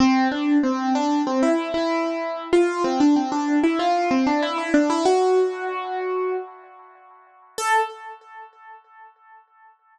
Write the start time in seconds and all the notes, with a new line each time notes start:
0.00 C4
0.31 D4
0.63 C4
0.95 D4
1.26 C4
1.42 E4
1.74 E4
2.53 F4
2.84 C4
3.00 D4
3.16 C4
3.32 D4
3.63 E4
3.79 F4
4.11 C4
4.26 D4
4.42 E4
4.58 E4
4.74 D4
4.90 E4
5.05 F#4
7.58 A4